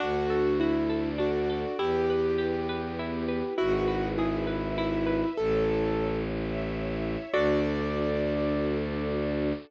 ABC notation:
X:1
M:6/8
L:1/8
Q:3/8=67
K:D
V:1 name="Acoustic Grand Piano"
F2 E2 F2 | G6 | F2 E2 E2 | "^rit." A3 z3 |
d6 |]
V:2 name="Orchestral Harp"
D A F A D A | E B G B E B | E B ^G B E B | "^rit." z6 |
[DFA]6 |]
V:3 name="Violin" clef=bass
D,,6 | E,,6 | ^G,,,6 | "^rit." A,,,6 |
D,,6 |]
V:4 name="String Ensemble 1"
[DFA]3 [DAd]3 | [EGB]3 [B,EB]3 | [E^GB]3 [EBe]3 | "^rit." [EAc]3 [Ece]3 |
[DFA]6 |]